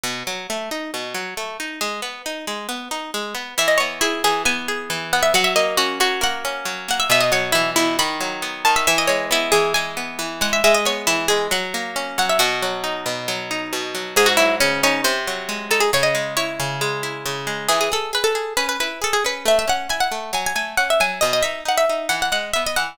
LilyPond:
<<
  \new Staff \with { instrumentName = "Orchestral Harp" } { \time 4/4 \key e \major \tempo 4 = 136 r1 | r1 | e''16 dis''16 cis''8 e'8 gis'8 gis''4. fis''16 e''16 | fis''16 e''16 dis''8 fis'8 fis'8 fis''4. fis''16 e''16 |
e''16 dis''16 cis''8 e'8 e'8 b''4. a''16 e''16 | e''16 dis''16 cis''8 e'8 gis'8 gis''4. fis''16 e''16 | e''16 dis''16 cis''8 e'8 gis'8 fis''4. fis''16 e''16 | fis'2. r4 |
gis'16 fis'16 e'8 cis'8 cis'8 bis'4. a'16 gis'16 | cis''16 dis''8. cis''2 r4 | gis'16 gis'16 a'8 b'16 a'8. b'16 b'16 b'8 a'16 gis'16 b'8 | e''16 e''16 fis''8 gis''16 fis''8. gis''16 gis''16 gis''8 fis''16 e''16 gis''8 |
dis''16 dis''16 e''8 fis''16 e''8. fis''16 fis''16 fis''8 e''16 dis''16 fis''8 | }
  \new Staff \with { instrumentName = "Orchestral Harp" } { \time 4/4 \key e \major b,8 fis8 a8 dis'8 b,8 fis8 a8 dis'8 | gis8 b8 dis'8 gis8 b8 dis'8 gis8 b8 | e8 b8 gis'8 e8 b8 gis'8 e8 b8 | fis8 ais8 cis'8 fis8 ais8 cis'8 fis8 ais8 |
b,8 fis8 e8 b,8 dis8 fis8 b8 dis8 | e8 gis8 b8 e8 gis8 b8 e8 gis8 | gis8 b8 e8 gis8 fis8 ais8 cis'8 fis8 | b,8 fis8 dis'8 b,8 fis8 dis'8 b,8 fis8 |
gis,8 fis8 cis8 dis'8 bis,8 fis8 gis8 dis'8 | cis8 gis8 e'8 cis8 gis8 e'8 cis8 gis8 | e8 gis'8 gis'8 gis'8 cis'8 e'8 gis'8 cis'8 | a8 cis'8 e'8 a8 fis8 a8 cis'8 fis8 |
b,8 dis'8 dis'8 dis'8 e8 gis8 b8 e8 | }
>>